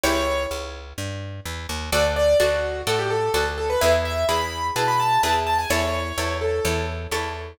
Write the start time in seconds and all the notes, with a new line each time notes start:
0.04 C#2 E4 G4 C#5
0.51 C#2
0.98 G2
1.45 E2
1.69 D#2
1.92 D2 F#4 A4 D5
2.16 D5
2.40 D2 F#4 A4 D5
2.87 A2 F#4 A4 D5
2.99 G4
3.10 A4
3.34 D2 F#4 A4 D5
3.58 A4
3.70 B4
3.81 E2 E4 G#4 B4 E5
4.05 E5
4.29 E2 E4 G#4 B4 B5
4.76 B2 E4 G#4 B4 A5
4.88 B5
5.00 A5
5.23 E2 E4 G#4 B4 A5
5.47 A5
5.59 G#5
5.70 E2 E4 A4 C#5
6.18 E2 E4 A4 C#5
6.41 A4
6.65 E2 E4 A4 C#5
7.11 E2 E4 A4 C#5